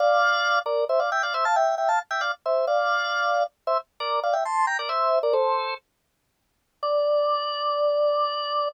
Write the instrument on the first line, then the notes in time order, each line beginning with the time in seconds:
drawbar organ
0.00 D5 F5
0.66 A#4 D5
0.89 C5 E5
1.00 D5 F5
1.12 E5 G5
1.23 D5 F5
1.34 C5 E5
1.45 F5 A5
1.56 E5 G5
1.78 E5 G5
1.89 F5 A5
2.11 E5 G5
2.21 D5 F5
2.46 C5 E5
2.67 D5 F5
3.67 C5 E5
4.00 A#4 D5
4.23 D5 F5
4.33 E5 G5
4.45 A5 C6
4.67 G5 A#5
4.79 A#4 D5
4.89 C5 E5
5.23 A#4 D5
5.33 A4 C5
6.83 D5